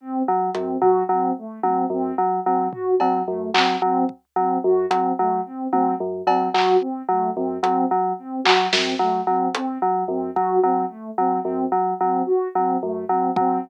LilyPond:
<<
  \new Staff \with { instrumentName = "Electric Piano 2" } { \clef bass \time 5/8 \tempo 4 = 110 r8 fis8 fis,8 fis8 fis8 | r8 fis8 fis,8 fis8 fis8 | r8 fis8 fis,8 fis8 fis8 | r8 fis8 fis,8 fis8 fis8 |
r8 fis8 fis,8 fis8 fis8 | r8 fis8 fis,8 fis8 fis8 | r8 fis8 fis,8 fis8 fis8 | r8 fis8 fis,8 fis8 fis8 |
r8 fis8 fis,8 fis8 fis8 | r8 fis8 fis,8 fis8 fis8 | }
  \new Staff \with { instrumentName = "Ocarina" } { \time 5/8 c'8 r8 c'8 fis'8 c'8 | a8 c'8 c'8 r8 c'8 | fis'8 c'8 a8 c'8 c'8 | r8 c'8 fis'8 c'8 a8 |
c'8 c'8 r8 c'8 fis'8 | c'8 a8 c'8 c'8 r8 | c'8 fis'8 c'8 a8 c'8 | c'8 r8 c'8 fis'8 c'8 |
a8 c'8 c'8 r8 c'8 | fis'8 c'8 a8 c'8 c'8 | }
  \new DrumStaff \with { instrumentName = "Drums" } \drummode { \time 5/8 r4 hh8 tomfh4 | r8 tommh4 r4 | tomfh8 cb4 hc4 | bd4. hh4 |
r8 tommh4 cb8 hc8 | r4. hh4 | r8 hc8 sn8 r4 | hh4. bd4 |
r4. r4 | r4. r8 bd8 | }
>>